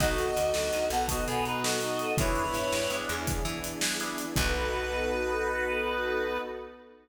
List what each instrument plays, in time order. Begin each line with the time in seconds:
0.00 electric bass (finger) B1, drawbar organ B3 D#4 F#4 A4, pad 2 (warm) B3 D#4 F#4 A4, lead 1 (square) D#4, clarinet F#4 D#5, kick, crash
0.18 closed hi-hat
0.36 electric bass (finger) D2, closed hi-hat
0.54 electric bass (finger) D2, lead 1 (square) F#4, snare
0.73 electric bass (finger) D2, lead 1 (square) D#4, closed hi-hat
0.90 electric bass (finger) B1, lead 1 (square) B3, clarinet A4 F#5, closed hi-hat
1.08 lead 1 (square) B3, clarinet F#4 D#5, kick, closed hi-hat
1.27 electric bass (finger) B2, clarinet B3 G#4, closed hi-hat
1.45 clarinet D#4 B4, closed hi-hat
1.64 clarinet F#4 D#5, snare
1.81 lead 1 (square) D#4, closed hi-hat
1.99 closed hi-hat
2.17 electric bass (finger) E2, drawbar organ B3 D4 E4 G#4, pad 2 (warm) B3 D4 E4 G#4, clarinet E4 C#5, lead 1 (square) B4, kick, closed hi-hat
2.35 closed hi-hat
2.54 electric bass (finger) G2, closed hi-hat
2.72 electric bass (finger) G2, snare
2.90 electric bass (finger) G2, drawbar organ B3 D4 E4 G#4, closed hi-hat
3.09 electric bass (finger) E2, lead 1 (square) G#4, closed hi-hat
3.27 kick, closed hi-hat
3.45 electric bass (finger) E3, closed hi-hat
3.64 closed hi-hat
3.81 drawbar organ B3 D4 E4 G#4, snare
4.00 drawbar organ B3 D4 E4 G#4, closed hi-hat
4.18 closed hi-hat
4.36 electric bass (finger) B1, drawbar organ B3 D#4 F#4 A4, pad 2 (warm) B3 D#4 F#4 A4, lead 1 (square) B4, clarinet B4, kick, crash